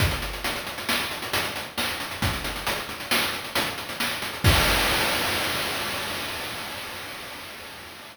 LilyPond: \new DrumStaff \drummode { \time 5/4 \tempo 4 = 135 <hh bd>16 hh16 hh16 hh16 hh16 hh16 hh16 hh16 sn16 hh16 hh16 hh16 hh16 hh16 hh8 <hh sn>16 hh16 hh16 hh16 | <hh bd>16 hh16 hh16 hh16 hh16 hh16 hh16 hh16 sn16 hh16 hh16 hh16 hh16 hh16 hh16 hh16 sn16 hh16 hh16 hh16 | <cymc bd>4 r4 r4 r4 r4 | }